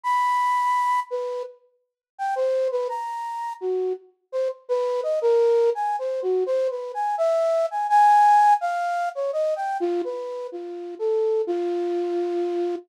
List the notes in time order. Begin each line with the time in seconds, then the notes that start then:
0.04 B5
1.11 B4
2.18 G5
2.36 C5
2.72 B4
2.89 A#5
3.61 F#4
4.32 C5
4.69 B4
5.03 D#5
5.22 A#4
5.75 G#5
5.99 C5
6.22 F#4
6.46 C5
6.70 B4
6.94 G#5
7.18 E5
7.71 G#5
7.89 G#5
8.61 F5
9.15 C#5
9.33 D#5
9.56 G5
9.80 F4
10.04 B4
10.52 F4
10.99 A4
11.47 F4